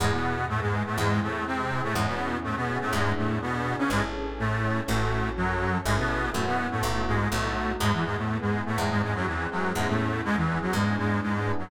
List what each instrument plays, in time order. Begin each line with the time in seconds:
0.00 electric bass (finger) E2, accordion G#2 G#3, electric piano 1 B3 E4, pad 2 (warm) B3 E4 G#4
0.04 electric piano 1 G#4
0.12 accordion B2 B3
0.49 accordion A2 A3, pad 2 (warm) B3 G#4 B4
0.61 accordion G#2 G#3
0.73 electric piano 1 B3 E4
0.77 electric piano 1 G#4
0.85 accordion A2 A3
0.97 electric bass (finger) E2, accordion G#2 G#3, electric piano 1 C4 E4, pad 2 (warm) C4 E4 G#4
1.01 electric piano 1 G#4
1.22 accordion A2 A3
1.46 accordion C3 C4, pad 2 (warm) G#3 C4 G#4
1.71 electric piano 1 C4 E4
1.75 electric piano 1 G#4
1.83 accordion A2 A3
1.95 electric bass (finger) E2, accordion G#2 G#3, electric piano 1 B3 C#4, pad 2 (warm) B3 C#4 E4 G#4
1.99 electric piano 1 E4 G#4
2.07 accordion B2 B3
2.44 accordion A2 A3, pad 2 (warm) B3 C#4 G#4 B4
2.56 accordion B2 B3
2.69 electric piano 1 B3 C#4
2.74 electric piano 1 E4 G#4
2.81 accordion A2 A3
2.93 electric bass (finger) E2, accordion G#2 G#3, electric piano 1 B3 D4, pad 2 (warm) B3 D4 E4 G#4
2.97 electric piano 1 E4 G#4
3.17 accordion A2 A3
3.41 accordion B2 B3, pad 2 (warm) B3 D4 G#4 B4
3.66 electric piano 1 B3 D4
3.71 electric piano 1 E4 G#4
3.78 accordion C#3 C#4
3.90 electric bass (finger) A1, accordion G#2 G#3, pad 2 (warm) C#4 E4 G#4 A4, electric piano 1 C#4 E4
3.96 electric piano 1 G#4 A4
4.39 accordion A2 A3, pad 2 (warm) C#4 E4 A4 C#5
4.64 electric piano 1 C#4 E4
4.68 electric piano 1 G#4 A4
4.87 electric bass (finger) A1, accordion A2 A3, electric piano 1 C#4 F#4, pad 2 (warm) C#4 F#4 A4
4.91 electric piano 1 A4
5.37 accordion F#2 F#3, pad 2 (warm) C#4 A4 C#5
5.62 electric piano 1 C#4 F#4
5.67 electric piano 1 A4
5.85 electric bass (finger) A1, accordion G#2 G#3, pad 2 (warm) C#4 E4 G#4 A4, electric piano 1 C#4 E4
5.91 electric piano 1 G#4 A4
5.98 accordion B2 B3
6.33 electric bass (finger) F#2, accordion A2 A3, electric piano 1 B3 C#4, pad 2 (warm) B3 C#4 E4 F#4
6.38 electric piano 1 E4 F#4
6.46 accordion B2 B3
6.71 accordion A2 A3
6.83 electric bass (finger) B1, accordion A2 A3, electric piano 1 A3 B3, pad 2 (warm) A3 B3 E4 F#4
6.87 electric piano 1 E4 F#4
7.07 accordion G#2 G#3
7.31 electric bass (finger) B1, accordion A2 A3, electric piano 1 A3 B3, pad 2 (warm) A3 B3 D#4 F#4
7.35 electric piano 1 D#4 F#4
7.80 electric bass (finger) E2, accordion G#2 G#3, pad 2 (warm) B3 E4 G#4, electric piano 1 B3 E4
7.86 electric piano 1 G#4
7.93 accordion E2 E3
8.05 accordion G#2 G#3
8.17 accordion A2 A3
8.29 pad 2 (warm) B3 G#4 B4
8.41 accordion G#2 G#3
8.54 electric piano 1 B3 E4
8.58 electric piano 1 G#4
8.66 accordion A2 A3
8.78 electric bass (finger) E2, accordion G#2 G#3, pad 2 (warm) C4 E4 G#4, electric piano 1 C4 E4
8.83 electric piano 1 G#4
8.90 accordion G#2 G#3
9.02 accordion G#2 G#3
9.15 accordion F#2 F#3
9.27 accordion E2 E3, pad 2 (warm) G#3 C4 G#4
9.51 accordion F#2 F#3, electric piano 1 C4 E4
9.55 electric piano 1 G#4
9.75 electric bass (finger) E2, accordion G#2 G#3, electric piano 1 B3 C#4, pad 2 (warm) B3 C#4 E4 G#4
9.80 electric piano 1 E4 G#4
9.88 accordion A2 A3
10.24 accordion G#2 G#3, pad 2 (warm) B3 C#4 G#4 B4
10.36 accordion E2 E3
10.48 electric piano 1 B3 C#4
10.53 electric piano 1 E4 G#4
10.61 accordion F#2 F#3
10.73 electric bass (finger) E2, accordion G#2 G#3, pad 2 (warm) B3 D4 E4 G#4, electric piano 1 B3
10.77 electric piano 1 D4 E4
10.81 electric piano 1 G#4
10.98 accordion G#2 G#3
11.22 accordion G#2 G#3, pad 2 (warm) B3 D4 G#4 B4
11.46 electric piano 1 B3 D4
11.51 electric piano 1 E4 G#4
11.59 accordion F#2 F#3